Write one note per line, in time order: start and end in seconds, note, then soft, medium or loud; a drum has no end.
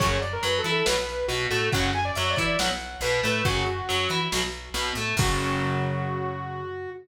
0.00 0.38 F#2 loud
0.00 0.17 C#3 loud
0.00 0.17 F#3 loud
0.00 0.18 C#5 loud
0.00 kick medium
0.00 closed hi-hat medium
0.22 0.32 D5 medium
0.22 closed hi-hat medium
0.33 0.43 A#4 medium
0.43 0.62 F#2 medium
0.43 0.61 F#3 medium
0.43 0.58 B4 medium
0.43 closed hi-hat medium
0.59 0.71 A4 loud
0.64 0.83 E3 medium
0.64 0.84 E4 medium
0.64 closed hi-hat medium
0.72 0.86 A4 loud
0.86 1.24 B1 loud
0.86 0.95 B2 loud
0.86 0.95 F#3 loud
0.86 1.26 B4 medium
0.86 snare loud
1.09 closed hi-hat medium
1.28 1.47 B1 medium
1.28 1.47 B2 medium
1.28 1.46 F#4 medium
1.28 closed hi-hat medium
1.51 1.70 A2 medium
1.51 1.69 A3 medium
1.51 1.70 F#4 medium
1.51 closed hi-hat medium
1.72 2.11 F#2 loud
1.72 1.90 C#3 loud
1.72 1.90 F#3 loud
1.72 1.90 F#5 loud
1.72 kick medium
1.72 closed hi-hat medium
1.93 2.05 G#5 loud
1.93 closed hi-hat medium
2.05 2.15 D5 loud
2.15 2.35 F#2 medium
2.15 2.36 F#3 medium
2.15 2.30 E5 medium
2.15 closed hi-hat medium
2.30 2.44 D5 medium
2.36 2.57 E3 medium
2.36 2.56 E4 medium
2.36 kick medium
2.36 closed hi-hat medium
2.44 2.58 D5 medium
2.59 2.96 B1 medium
2.59 2.68 B2 loud
2.59 2.68 F#3 loud
2.59 2.98 F#5 medium
2.59 snare medium
2.80 closed hi-hat medium
3.01 3.19 B1 medium
3.01 3.21 B2 medium
3.01 3.20 B4 loud
3.01 closed hi-hat medium
3.23 3.43 A2 loud
3.23 3.42 A3 medium
3.23 3.45 B4 medium
3.23 closed hi-hat medium
3.45 3.82 F#2 loud
3.45 3.63 C#3 loud
3.45 3.63 F#3 loud
3.45 4.19 F#4 loud
3.45 kick medium
3.45 closed hi-hat medium
3.66 closed hi-hat medium
3.89 4.08 F#2 medium
3.89 4.07 F#3 medium
3.89 closed hi-hat medium
4.09 4.28 E3 medium
4.09 4.29 E4 medium
4.09 closed hi-hat medium
4.32 4.69 B1 medium
4.32 4.41 B2 loud
4.32 4.41 F#3 loud
4.32 snare medium
4.53 closed hi-hat medium
4.74 4.92 B1 medium
4.74 4.92 B2 medium
4.74 closed hi-hat medium
4.95 5.14 A2 medium
4.95 5.15 A3 medium
4.95 closed hi-hat medium
5.17 6.88 F#2 loud
5.17 6.89 C#3 loud
5.17 6.89 F#3 loud
5.17 6.90 F#4 loud
5.17 kick loud
5.17 crash loud